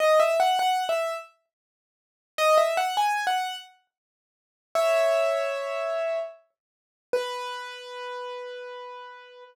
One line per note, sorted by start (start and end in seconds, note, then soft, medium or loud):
0.00 0.19 D#5 loud
0.20 0.38 E5 loud
0.40 0.59 F#5 loud
0.59 0.84 F#5 loud
0.89 1.14 E5 medium
2.38 2.57 D#5 loud
2.58 2.76 E5 loud
2.77 2.96 F#5 loud
2.97 3.25 G#5 medium
3.27 3.56 F#5 loud
4.75 6.19 C#5 medium
4.75 6.19 E5 loud
7.13 9.44 B4 loud